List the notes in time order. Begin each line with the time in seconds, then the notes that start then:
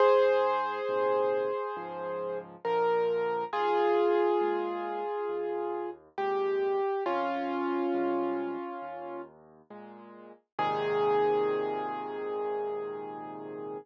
0.00 G#2 G#4 C5
0.89 A#2 C3 D#3
1.76 C#2 G#2 F3
2.65 A#2 D3 F3 A#4
3.53 D#2 F4 G#4
4.41 A#2 G#3
5.29 D#2
6.18 A#2 C3 G#3 G4
7.06 F2 C#4 F4
7.94 C3 G3 G#3
8.82 D#2
9.70 A#2 G#3
10.58 G#2 A#2 C3 D#3 G#4